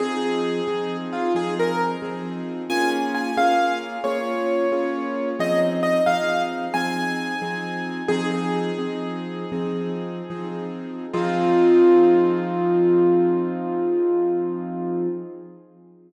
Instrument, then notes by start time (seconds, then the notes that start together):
acoustic grand piano
0.00 F3 C4 D#4 G#4
0.68 F3 C4 D#4 G#4
1.13 F4
1.35 F3 C4 D#4 G#4
1.59 A#4
2.02 F3 C4 D#4 G#4
2.70 A#3 C#4 F4 G#4 G#5
3.15 G#5
3.37 A#3 C#4 F4 G#4 F5
4.04 A#3 C#4 F4 G#4 C#5
4.72 A#3 C#4 F4 G#4
5.39 F3 C4 D#4 G#4 D#5
5.83 D#5
6.06 F3 C4 D#4 G#4 F5
6.74 F3 C4 D#4 G#4 G#5
7.42 F3 C4 D#4 G#4
8.08 F3 C4 D#4 G#4
8.31 G#4
8.78 F3 C4 D#4 G#4
9.52 F3 C4 D#4 G#4
10.30 F3 C4 D#4 G#4
11.13 F3 C4 D#4 F4 G#4